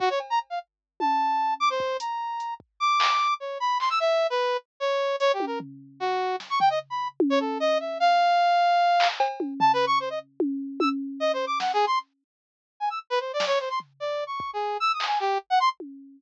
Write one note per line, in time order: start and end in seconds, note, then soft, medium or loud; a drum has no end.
0.00 0.09 F#4 loud
0.00 kick medium
0.10 0.19 C#5 medium
0.20 cowbell medium
0.30 0.39 A#5 medium
0.50 0.59 F5 medium
1.00 1.54 A5 medium
1.00 high tom medium
1.60 1.69 D6 loud
1.70 1.97 C5 medium
1.80 kick loud
2.00 2.54 A#5 soft
2.00 closed hi-hat loud
2.40 closed hi-hat medium
2.60 kick medium
2.80 3.34 D6 loud
3.00 clap loud
3.40 3.58 C#5 medium
3.60 3.78 B5 medium
3.80 3.89 C6 medium
3.80 clap medium
3.90 3.99 E6 loud
4.00 4.27 E5 loud
4.30 4.57 B4 medium
4.80 5.16 C#5 medium
5.20 5.32 C#5 loud
5.20 closed hi-hat medium
5.33 5.45 G4 medium
5.40 high tom medium
5.47 5.59 A#4 medium
5.60 floor tom medium
6.00 6.36 F#4 medium
6.40 snare medium
6.50 6.59 C#6 medium
6.60 6.69 G5 loud
6.60 floor tom medium
6.70 6.79 D#5 medium
6.90 7.08 B5 medium
7.20 high tom loud
7.30 7.39 C#5 loud
7.40 7.58 A4 medium
7.60 7.78 D#5 loud
7.80 7.98 E5 medium
8.00 9.08 F5 loud
9.00 clap loud
9.20 cowbell loud
9.40 high tom medium
9.60 9.72 A5 loud
9.60 floor tom loud
9.73 9.85 B4 loud
9.87 9.99 C#6 loud
10.00 10.09 C5 medium
10.10 10.19 D#5 medium
10.40 high tom loud
10.80 10.89 E6 medium
10.80 high tom loud
11.20 11.32 D#5 loud
11.33 11.45 C5 medium
11.47 11.59 D6 medium
11.60 11.72 F#5 medium
11.60 snare medium
11.73 11.85 G#4 medium
11.87 11.99 C6 medium
12.80 12.89 G#5 medium
12.90 12.99 E6 medium
13.10 13.19 B4 loud
13.20 13.32 C5 medium
13.33 13.45 D5 medium
13.40 snare medium
13.47 13.59 C#5 loud
13.60 13.69 C5 medium
13.70 13.79 C6 medium
13.80 floor tom medium
14.00 14.24 D5 medium
14.27 14.51 C#6 medium
14.40 kick loud
14.53 14.77 G#4 medium
14.80 14.92 E6 loud
14.93 15.05 D#6 medium
15.00 clap loud
15.07 15.19 G#5 medium
15.20 15.38 G4 medium
15.50 15.59 F#5 loud
15.60 15.69 C6 loud
15.80 high tom medium